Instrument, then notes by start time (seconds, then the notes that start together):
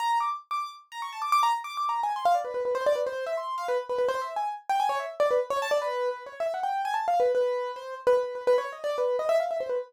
acoustic grand piano
0.00 A#5
0.20 D6
0.51 D6
0.92 A#5
1.02 C#6
1.13 A5
1.22 D6
1.32 D6
1.43 A#5
1.64 D6
1.77 D6
1.89 A#5
2.03 G#5
2.16 C6
2.25 F5
2.34 D5
2.44 B4
2.54 B4
2.65 B4
2.75 C5
2.86 D5
2.95 B4
3.07 C5
3.27 E5
3.37 C6
3.58 F5
3.68 B4
3.89 B4
3.98 B4
4.09 C5
4.21 E5
4.36 G#5
4.69 G5
4.80 G#5
4.89 C#5
4.99 E5
5.20 D5
5.31 B4
5.50 C#5
5.62 A5
5.71 D5
5.82 B4
6.11 B4
6.26 C#5
6.40 E5
6.54 F#5
6.63 G5
6.85 G#5
6.94 A5
7.08 F5
7.20 B4
7.35 B4
7.76 C5
8.07 B4
8.17 B4
8.35 B4
8.47 B4
8.58 C#5
8.72 D#5
8.84 D5
8.98 B4
9.19 D#5
9.29 E5
9.40 F5
9.51 E5
9.60 C5
9.69 B4